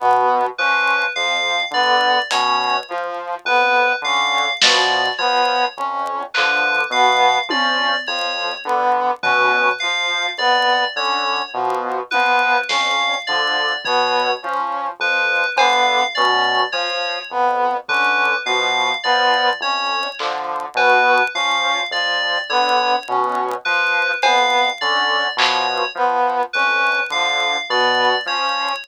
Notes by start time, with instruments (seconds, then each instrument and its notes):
0.00 lead 2 (sawtooth) B2, brass section B3
0.58 lead 2 (sawtooth) F3, brass section C#4, electric piano 2 B4
1.15 lead 2 (sawtooth) F2, brass section F3, electric piano 2 F5
1.71 lead 2 (sawtooth) D3, brass section B3, electric piano 2 D5
2.31 lead 2 (sawtooth) B2, brass section C#4, electric piano 2 C#5, closed hi-hat
2.88 brass section F3, lead 2 (sawtooth) F3
3.45 lead 2 (sawtooth) F2, brass section B3, electric piano 2 B4
4.02 lead 2 (sawtooth) D3, brass section C#4, electric piano 2 F5
4.62 lead 2 (sawtooth) B2, brass section F3, electric piano 2 D5, snare
5.18 lead 2 (sawtooth) F3, brass section B3, electric piano 2 C#5
5.77 lead 2 (sawtooth) F2, brass section C#4
6.34 lead 2 (sawtooth) D3, brass section F3, electric piano 2 B4, clap
6.90 lead 2 (sawtooth) B2, brass section B3, electric piano 2 F5
7.49 lead 2 (sawtooth) F3, brass section C#4, electric piano 2 D5, high tom
8.07 lead 2 (sawtooth) F2, brass section F3, electric piano 2 C#5
8.65 lead 2 (sawtooth) D3, brass section B3
9.23 lead 2 (sawtooth) B2, brass section C#4, electric piano 2 B4, floor tom
9.80 brass section F3, lead 2 (sawtooth) F3, electric piano 2 F5
10.38 lead 2 (sawtooth) F2, brass section B3, electric piano 2 D5
10.96 lead 2 (sawtooth) D3, brass section C#4, electric piano 2 C#5
11.54 lead 2 (sawtooth) B2, brass section F3
12.11 lead 2 (sawtooth) F3, brass section B3, electric piano 2 B4, high tom
12.69 lead 2 (sawtooth) F2, brass section C#4, electric piano 2 F5, snare
13.27 lead 2 (sawtooth) D3, brass section F3, electric piano 2 D5
13.85 lead 2 (sawtooth) B2, brass section B3, electric piano 2 C#5, kick
14.42 lead 2 (sawtooth) F3, brass section C#4
14.99 lead 2 (sawtooth) F2, brass section F3, electric piano 2 B4
15.56 lead 2 (sawtooth) D3, brass section B3, electric piano 2 F5, cowbell
16.15 lead 2 (sawtooth) B2, brass section C#4, electric piano 2 D5
16.72 brass section F3, lead 2 (sawtooth) F3, electric piano 2 C#5, cowbell
17.30 lead 2 (sawtooth) F2, brass section B3
17.88 lead 2 (sawtooth) D3, brass section C#4, electric piano 2 B4, kick
18.46 lead 2 (sawtooth) B2, brass section F3, electric piano 2 F5
19.04 lead 2 (sawtooth) F3, brass section B3, electric piano 2 D5
19.60 lead 2 (sawtooth) F2, brass section C#4, electric piano 2 C#5
20.19 lead 2 (sawtooth) D3, brass section F3, clap
20.75 lead 2 (sawtooth) B2, brass section B3, electric piano 2 B4, cowbell
21.35 lead 2 (sawtooth) F3, brass section C#4, electric piano 2 F5
21.91 lead 2 (sawtooth) F2, brass section F3, electric piano 2 D5
22.50 lead 2 (sawtooth) D3, brass section B3, electric piano 2 C#5
23.08 lead 2 (sawtooth) B2, brass section C#4
23.65 brass section F3, lead 2 (sawtooth) F3, electric piano 2 B4
24.22 lead 2 (sawtooth) F2, brass section B3, electric piano 2 F5, cowbell
24.81 lead 2 (sawtooth) D3, brass section C#4, electric piano 2 D5
25.37 lead 2 (sawtooth) B2, brass section F3, electric piano 2 C#5, clap
25.95 lead 2 (sawtooth) F3, brass section B3
26.53 lead 2 (sawtooth) F2, brass section C#4, electric piano 2 B4
27.10 lead 2 (sawtooth) D3, brass section F3, electric piano 2 F5
27.69 lead 2 (sawtooth) B2, brass section B3, electric piano 2 D5
28.26 lead 2 (sawtooth) F3, brass section C#4, electric piano 2 C#5